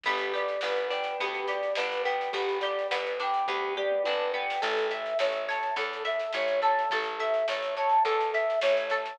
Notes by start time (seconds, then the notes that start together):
0.03 G1 B3 G4, kick, snare
0.18 snare
0.34 G4 D5, snare
0.48 snare
0.61 G1 B3 B4, snare
0.76 snare
0.90 D4 G5, snare
1.04 snare
1.20 D2 B3 G4, kick, snare
1.34 snare
1.47 G4 D5, snare
1.63 snare
1.75 G1 D4 B4, snare
1.92 snare
2.04 B3 G5, snare
2.21 snare
2.32 G1 B3 G4, kick, snare
2.49 snare
2.61 G4 D5, snare
2.79 snare
2.91 G1 B3 B4, snare
3.06 snare
3.20 D4 G5, snare
3.34 snare
3.46 D2 B3 G4, kick, floor tom
3.76 G4 D5, mid tom
3.92 mid tom
4.04 G1 D4 B4, high tom
4.34 B3 G5
4.50 snare
4.61 A1 A4, kick, snare, crash
4.77 snare
4.91 E5, snare
5.05 snare
5.19 A1 A4 C#5, snare
5.32 snare
5.49 C#5 A5, snare
5.63 snare
5.76 E2 A4, kick, snare
5.93 snare
6.05 E5, snare
6.20 snare
6.33 A1 C#5, snare
6.48 snare
6.62 A4 A5, snare
6.79 snare
6.90 A1 A4, kick, snare
7.04 snare
7.20 E5, snare
7.34 snare
7.48 A1 A4 C#5, snare
7.63 snare
7.77 C#5 A5, snare
7.89 snare
8.05 E2 A4, kick, snare
8.20 snare
8.33 E5, snare
8.50 snare
8.61 A1 C#5, snare
8.77 snare
8.90 A4 A5, snare
9.06 snare